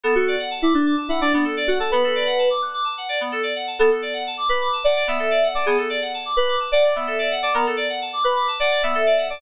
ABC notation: X:1
M:4/4
L:1/16
Q:1/4=128
K:Bm
V:1 name="Electric Piano 2"
A F2 z2 E D2 z E D D z2 F A | B6 z10 | A z5 B2 z d2 e4 d | ^G z5 B2 z d2 e4 d |
^A z5 B2 z d2 e4 d |]
V:2 name="Electric Piano 2"
B, A d f a d' f' d' a f d B, A d f a | B, A d f a d' f' d' a f d B, A d f a | B, A d f a d' f' d' a f d B, A d f a | B, A d f a d' f' d' a f d B, A d f a |
B, A d f a d' f' d' a f d B, A d f a |]